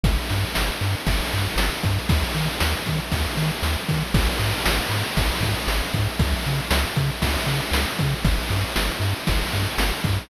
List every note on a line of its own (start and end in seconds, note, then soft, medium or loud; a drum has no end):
0.03 0.18 G1 loud
0.03 kick loud
0.03 ride loud
0.30 0.45 G2 medium
0.30 ride medium
0.55 0.71 G1 medium
0.55 snare loud
0.81 0.95 G2 medium
0.81 ride medium
1.07 1.21 G1 loud
1.07 kick medium
1.07 ride loud
1.32 1.48 G2 medium
1.32 ride medium
1.56 1.70 G1 medium
1.56 snare loud
1.83 1.99 G2 loud
1.83 kick medium
1.83 ride medium
2.09 2.24 D#2 loud
2.09 kick loud
2.09 ride loud
2.35 2.49 D#3 medium
2.35 ride medium
2.60 2.75 D#2 medium
2.60 snare loud
2.86 3.00 D#3 medium
2.86 kick medium
2.86 ride medium
3.12 3.27 D#2 medium
3.12 kick medium
3.12 ride loud
3.37 3.51 D#3 medium
3.37 ride medium
3.63 3.77 D#2 medium
3.63 snare loud
3.89 4.03 D#3 medium
3.89 kick medium
3.89 ride medium
4.14 4.28 G#1 loud
4.14 kick loud
4.14 crash loud
4.39 4.54 G#2 medium
4.39 ride medium
4.65 4.80 G#1 medium
4.65 snare loud
4.89 5.04 G#2 medium
4.89 ride medium
5.17 5.31 G#1 medium
5.17 kick medium
5.17 ride loud
5.41 5.55 G#2 medium
5.41 kick medium
5.41 ride medium
5.67 5.82 G#1 medium
5.67 snare loud
5.94 6.08 G#2 loud
5.94 kick medium
5.94 ride medium
6.19 6.34 C#2 loud
6.19 kick loud
6.19 ride loud
6.45 6.61 C#3 medium
6.45 ride medium
6.71 6.85 C#2 loud
6.71 snare loud
6.96 7.11 C#3 loud
6.96 kick medium
6.96 ride medium
7.22 7.37 C#2 medium
7.22 kick medium
7.22 ride loud
7.47 7.61 C#3 medium
7.47 ride medium
7.71 7.85 C#2 medium
7.71 snare loud
7.99 8.15 C#3 medium
7.99 kick medium
7.99 ride medium
8.24 8.39 G1 loud
8.24 kick loud
8.24 ride loud
8.50 8.64 G2 medium
8.50 ride medium
8.76 8.90 G1 medium
8.76 snare loud
9.00 9.14 G2 medium
9.00 ride medium
9.27 9.43 G1 loud
9.27 kick medium
9.27 ride loud
9.53 9.68 G2 medium
9.53 ride medium
9.78 9.92 G1 medium
9.78 snare loud
10.04 10.19 G2 loud
10.04 kick medium
10.04 ride medium